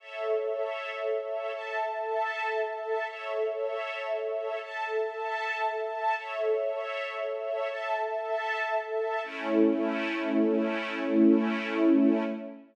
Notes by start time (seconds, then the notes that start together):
0.00 A4 C#5 E5
1.54 A4 E5 A5
3.07 A4 C#5 E5
4.62 A4 E5 A5
6.16 A4 C#5 E5
7.69 A4 E5 A5
9.23 A3 C#4 E4